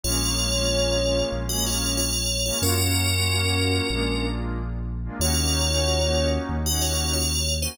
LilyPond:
<<
  \new Staff \with { instrumentName = "Tubular Bells" } { \time 4/4 \key bes \minor \tempo 4 = 93 <f' des''>2 r16 <ges' ees''>16 <f' des''>8 <f' des''>8. <f' des''>16 | <des' bes'>2. r4 | <f' des''>2 r16 <ges' ees''>16 <f' des''>8 <f' des''>8. <ees' c''>16 | }
  \new Staff \with { instrumentName = "Pad 2 (warm)" } { \time 4/4 \key bes \minor <aes bes des' f'>16 <aes bes des' f'>8 <aes bes des' f'>16 <aes bes des' f'>16 <aes bes des' f'>16 <aes bes des' f'>8. <aes bes des' f'>4. <aes bes des' f'>16 | <bes des' f' ges'>16 <bes des' f' ges'>8 <bes des' f' ges'>16 <bes des' f' ges'>16 <bes des' f' ges'>16 <bes des' f' ges'>8 <aes bes d' f'>16 <aes bes d' f'>4. <aes bes d' f'>16 | <bes des' ees' ges'>16 <bes des' ees' ges'>8 <bes des' ees' ges'>16 <bes des' ees' ges'>16 <bes des' ees' ges'>16 <bes des' ees' ges'>8. <bes des' ees' ges'>4. <bes des' ees' ges'>16 | }
  \new Staff \with { instrumentName = "Synth Bass 2" } { \clef bass \time 4/4 \key bes \minor bes,,2 bes,,2 | ges,2 bes,,2 | ees,2 ees,2 | }
>>